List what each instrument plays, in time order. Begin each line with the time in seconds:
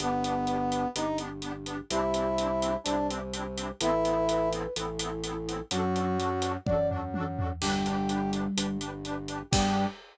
0.00 drawbar organ G1, accordion B3 D4, brass section B3, flute B4, closed hi-hat
0.05 accordion G4
0.24 accordion B3 D4, closed hi-hat
0.29 accordion G4
0.47 accordion B3 D4, closed hi-hat
0.53 accordion G4
0.71 accordion B3 D4, closed hi-hat
0.76 accordion G4
0.95 drawbar organ G1, accordion B3 D4, brass section D#4, closed hi-hat
1.00 accordion G4
1.18 accordion B3 D4, closed hi-hat
1.24 accordion G4
1.42 accordion B3 D4, closed hi-hat
1.48 accordion G4
1.66 accordion B3 D4, closed hi-hat
1.72 accordion G4
1.90 drawbar organ C2, accordion C4 D4, brass section E4, flute G4, closed hi-hat
1.96 accordion E4 G4
2.14 accordion C4 D4, closed hi-hat
2.19 accordion E4 G4
2.38 accordion C4 D4, closed hi-hat
2.43 accordion E4 G4
2.62 accordion C4 D4, closed hi-hat
2.67 accordion E4 G4
2.84 drawbar organ C2, accordion C4, brass section D4, closed hi-hat
2.88 accordion D4 E4
2.93 accordion G4
3.10 accordion C4 D4, closed hi-hat
3.14 accordion E4 G4
3.33 accordion C4 D4, closed hi-hat
3.38 accordion E4 G4
3.57 accordion C4 D4, closed hi-hat
3.62 accordion E4 G4
3.81 drawbar organ A1, accordion B3 C4, brass section E4, flute B4, closed hi-hat
3.86 accordion E4 A4
4.05 accordion B3 C4, closed hi-hat
4.10 accordion E4 A4
4.29 accordion B3 C4, flute B4, closed hi-hat
4.34 accordion E4 A4
4.52 accordion B3 C4, closed hi-hat
4.57 accordion E4 A4
4.76 drawbar organ A1, accordion B3 C4, flute E4, closed hi-hat
4.81 accordion E4 A4
4.99 accordion B3 C4, closed hi-hat
5.05 accordion E4 A4
5.24 accordion B3 C4, closed hi-hat
5.29 accordion E4 A4
5.48 accordion B3 C4, closed hi-hat
5.53 accordion E4 A4
5.71 drawbar organ F#2, flute F#3, accordion D4 F#4, brass section F#4, closed hi-hat
5.76 accordion A4
5.95 accordion D4 F#4, closed hi-hat
6.00 accordion A4
6.19 accordion D4 F#4, closed hi-hat
6.24 accordion A4
6.42 accordion D4 F#4, closed hi-hat
6.48 accordion A4
6.66 drawbar organ F#2, accordion D4 F#4, brass section D5, kick, high tom
6.72 accordion A4
6.90 accordion D4 F#4, floor tom
6.96 accordion A4
7.14 accordion D4 F#4, high tom
7.19 accordion A4
7.38 accordion D4 F#4, floor tom
7.43 accordion A4
7.61 drawbar organ G1, flute G3, accordion D4 G4, brass section G4, crash
7.67 accordion B4
7.86 accordion D4 G4, closed hi-hat
7.91 accordion B4
8.09 accordion D4 G4, closed hi-hat
8.14 accordion B4
8.33 accordion D4 G4, closed hi-hat
8.38 accordion B4
8.57 drawbar organ G1, accordion D4 G4, closed hi-hat
8.62 accordion B4
8.81 accordion D4 G4, closed hi-hat
8.86 accordion B4
9.05 accordion D4 G4, closed hi-hat
9.10 accordion B4
9.28 accordion D4 G4, closed hi-hat
9.34 accordion B4
9.51 drawbar organ G2, flute G3, accordion B3 D4, brass section G4, kick, crash
9.57 accordion G4